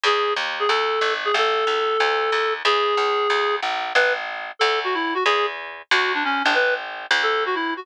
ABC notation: X:1
M:4/4
L:1/8
Q:"Swing" 1/4=184
K:A
V:1 name="Clarinet"
G2 z G A3 G | A8 | G6 z2 | B z3 A F E F |
G z3 F D C D | B z3 A F E F |]
V:2 name="Electric Bass (finger)" clef=bass
E,,2 ^D,,2 =D,,2 G,,,2 | A,,,2 C,,2 D,,2 ^D,,2 | E,,2 C,,2 D,,2 ^A,,,2 | A,,,4 D,,4 |
E,,4 D,,3 A,,,- | A,,,3 D,,5 |]